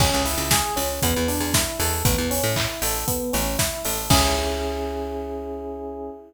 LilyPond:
<<
  \new Staff \with { instrumentName = "Electric Piano 1" } { \time 4/4 \key cis \minor \tempo 4 = 117 cis'8 e'8 gis'8 cis'8 b8 d'8 e'8 a'8 | b8 cis'8 e'8 a'8 b8 cis'8 e'8 a'8 | <cis' e' gis'>1 | }
  \new Staff \with { instrumentName = "Electric Bass (finger)" } { \clef bass \time 4/4 \key cis \minor cis,16 cis,8 cis,8. cis,8 e,16 e,8 e,8. e,8 | a,,16 e,8 a,8. a,,4 a,,4 a,,8 | cis,1 | }
  \new DrumStaff \with { instrumentName = "Drums" } \drummode { \time 4/4 <cymc bd>8 hho8 <bd sn>8 hho8 <hh bd>8 hho8 <bd sn>8 hho8 | <hh bd>8 hho8 <hc bd>8 hho8 <hh bd>8 hho8 <bd sn>8 hho8 | <cymc bd>4 r4 r4 r4 | }
>>